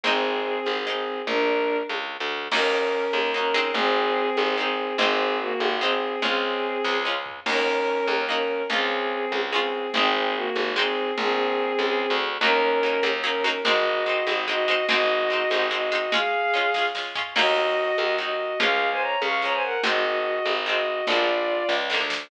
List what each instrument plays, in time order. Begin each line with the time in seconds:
0.04 electric bass (finger) G#1, pizzicato strings G#3 C4 D#4, violin C4 G#4, low conga
0.66 electric bass (finger) G#1, high conga
0.85 pizzicato strings G#3 C4, violin C4 G#4
0.90 pizzicato strings D#4
1.27 electric bass (finger) A#1, violin D4 A#4, low conga
1.89 electric bass (finger) C#2, high conga
2.20 electric bass (finger) D2
2.51 electric bass (finger) D#2, pizzicato strings A#3 D#4 F#4, violin C#4 A#4, crash, low conga
3.13 electric bass (finger) D#2, high conga
3.34 pizzicato strings A#3 D#4 F#4, violin C#4 A#4
3.54 pizzicato strings G#3 C4 D#4
3.74 electric bass (finger) G#1, violin C4 G#4, low conga
4.37 electric bass (finger) G#1, high conga
4.57 pizzicato strings G#3 C4 D#4, violin C4 G#4
4.98 electric bass (finger) G#1, pizzicato strings G#3 C4 D#4, violin C4 G#4, low conga
5.40 violin A#3 F#4
5.60 electric bass (finger) G#1, high conga
5.81 pizzicato strings G#3 C4 D#4, violin C4 G#4
6.22 electric bass (finger) C#2, pizzicato strings G#3 C#4 F4, violin C4 G#4, low conga
6.84 electric bass (finger) C#2, kick, snare
7.05 pizzicato strings G#3 C#4 F4
7.26 floor tom
7.46 electric bass (finger) D#2, pizzicato strings A#3 D#4 F#4, violin C#4 A#4, crash, low conga
8.07 electric bass (finger) D#2, high conga
8.29 pizzicato strings A#3 D#4 F#4, violin C#4 A#4
8.70 electric bass (finger) C#2, pizzicato strings G#3 C#4 F4, violin C4 G#4, low conga
9.32 electric bass (finger) C#2, high conga
9.52 pizzicato strings G#3 C#4 F4, violin C4 G#4
9.94 electric bass (finger) G#1, pizzicato strings G#3 C4 D#4, violin C4 G#4, low conga
10.35 violin A#3 F#4
10.55 electric bass (finger) G#1, high conga
10.76 pizzicato strings G#3 C4 D#4, violin C4 G#4
11.18 electric bass (finger) A#1, violin C4 G#4, low conga
11.79 electric bass (finger) C#2, high conga
12.10 electric bass (finger) D2
12.41 electric bass (finger) D#2, pizzicato strings F#3 A#3 D#4, violin C#4 A#4, low conga
12.83 pizzicato strings F#3 A#3 D#4
13.03 electric bass (finger) D#2, pizzicato strings F#3 A#3 D#4, high conga
13.24 pizzicato strings F#3 A#3 D#4, violin C#4 A#4
13.44 pizzicato strings F#3 A#3 D#4
13.65 electric bass (finger) G#1, pizzicato strings G#3 C4 D#4, violin F#4 D#5, low conga
14.06 pizzicato strings G#3 C4 D#4
14.27 electric bass (finger) G#1, pizzicato strings G#3 C4 D#4, high conga
14.48 pizzicato strings G#3 C4 D#4, violin F#4 D#5
14.68 pizzicato strings G#3 C4 D#4
14.88 electric bass (finger) G#1, pizzicato strings G#3 C4 D#4, violin F#4 D#5, low conga
15.30 pizzicato strings G#3 C4 D#4
15.50 electric bass (finger) G#1, pizzicato strings G#3 C4 D#4, high conga
15.71 pizzicato strings G#3 C4 D#4, violin F#4 D#5
15.92 pizzicato strings G#3 C4 D#4
16.12 pizzicato strings G#3 C#4 F4, violin G#4 F5, low conga
16.54 pizzicato strings G#3 C#4 F4
16.74 pizzicato strings G#3 C#4 F4, kick, snare
16.95 pizzicato strings G#3 C#4 F4, snare
17.15 pizzicato strings G#3 C#4 F4, floor tom
17.36 electric bass (finger) D#2, pizzicato strings F#3 A#3 D#4, violin F#4 D#5, crash, low conga
17.98 electric bass (finger) D#2, high conga
18.18 pizzicato strings F#3 A#3 D#4, violin F#4 D#5
18.59 electric bass (finger) C#2, pizzicato strings F3 G#3 C#4, violin G#4 F5, low conga
18.91 violin C5 G#5
19.01 violin C#5 A#5
19.22 electric bass (finger) C#2, violin F5 C#6, high conga
19.42 pizzicato strings F3 G#3 C#4, violin C#5 A#5
19.52 violin C5 G#5
19.63 violin A#4 F#5
19.83 electric bass (finger) G#1, pizzicato strings D#3 G#3 C4, violin F#4 D#5, low conga
20.45 electric bass (finger) G#1, high conga
20.66 pizzicato strings D#3 G#3 C4, violin F#4 D#5
21.07 electric bass (finger) A#1, pizzicato strings D3 F3 G#3, violin F4 D5, low conga
21.12 pizzicato strings A#3
21.69 electric bass (finger) C#2, kick, snare
21.90 pizzicato strings D3 F3 G#3, snare
21.94 pizzicato strings A#3
22.00 electric bass (finger) D2
22.10 snare